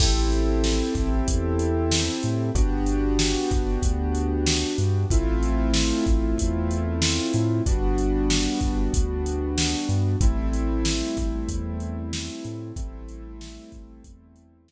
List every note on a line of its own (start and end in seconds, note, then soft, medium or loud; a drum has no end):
0.00 0.82 A1 loud
0.00 2.50 C4 loud
0.00 2.50 E4 medium
0.00 2.50 G4 loud
0.00 2.50 A4 medium
0.00 kick medium
0.00 crash loud
0.32 closed hi-hat medium
0.64 snare medium
0.95 1.22 A1 loud
0.95 kick medium
0.95 closed hi-hat medium
1.28 2.09 E2 loud
1.28 kick medium
1.28 closed hi-hat loud
1.59 closed hi-hat medium
1.91 snare loud
2.23 2.51 A2 medium
2.23 closed hi-hat medium
2.55 3.36 G1 loud
2.55 5.05 B3 medium
2.55 5.05 D4 loud
2.55 5.05 F#4 medium
2.55 5.05 G4 medium
2.55 kick medium
2.55 closed hi-hat medium
2.86 closed hi-hat medium
3.19 snare loud
3.51 3.78 G1 medium
3.51 kick medium
3.51 closed hi-hat medium
3.82 4.64 D2 loud
3.82 kick medium
3.82 closed hi-hat medium
4.15 closed hi-hat medium
4.46 snare loud
4.78 5.05 G2 loud
4.78 closed hi-hat medium
5.11 5.92 A1 loud
5.11 7.61 A3 loud
5.11 7.61 C4 loud
5.11 7.61 E4 loud
5.11 7.61 F4 loud
5.11 kick loud
5.11 closed hi-hat medium
5.43 closed hi-hat medium
5.74 snare loud
6.07 6.34 A1 loud
6.07 kick medium
6.07 closed hi-hat medium
6.38 7.20 E2 loud
6.38 kick medium
6.38 closed hi-hat loud
6.71 closed hi-hat medium
7.02 snare loud
7.34 7.61 A2 loud
7.34 closed hi-hat medium
7.66 8.48 G1 loud
7.66 10.16 G3 medium
7.66 10.16 B3 medium
7.66 10.16 D4 loud
7.66 10.16 F#4 medium
7.66 kick medium
7.66 closed hi-hat medium
7.98 closed hi-hat medium
8.30 snare loud
8.61 8.89 G1 medium
8.61 kick medium
8.61 closed hi-hat medium
8.94 9.75 D2 medium
8.94 kick medium
8.94 closed hi-hat loud
9.26 closed hi-hat medium
9.58 snare loud
9.89 10.16 G2 loud
9.89 closed hi-hat medium
10.21 11.02 A1 loud
10.21 12.72 G3 medium
10.21 12.72 A3 loud
10.21 12.72 C4 loud
10.21 12.72 E4 loud
10.21 kick loud
10.21 closed hi-hat medium
10.53 closed hi-hat medium
10.85 snare loud
11.17 11.44 A1 loud
11.17 kick medium
11.17 closed hi-hat medium
11.48 12.30 E2 loud
11.48 kick medium
11.48 closed hi-hat loud
11.80 closed hi-hat medium
12.13 snare loud
12.45 12.72 A2 loud
12.45 closed hi-hat medium
12.76 13.59 A1 loud
12.76 14.72 G3 medium
12.76 14.72 A3 loud
12.76 14.72 C4 loud
12.76 14.72 E4 medium
12.76 kick loud
12.76 closed hi-hat loud
13.09 closed hi-hat medium
13.41 snare loud
13.72 14.00 A1 loud
13.72 kick medium
13.72 closed hi-hat medium
14.04 14.72 E2 loud
14.04 kick medium
14.04 closed hi-hat loud
14.36 closed hi-hat medium
14.68 snare loud